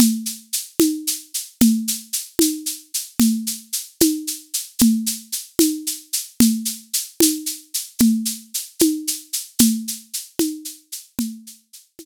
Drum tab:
SH |xxxxxx|xxxxxx|xxxxxx|xxxxxx|
CG |O--o--|O--o--|O--o--|O--o--|

SH |xxxxxx|xxxxxx|xxxxxx|xxxx--|
CG |O--o--|O--o--|O--o--|O--o--|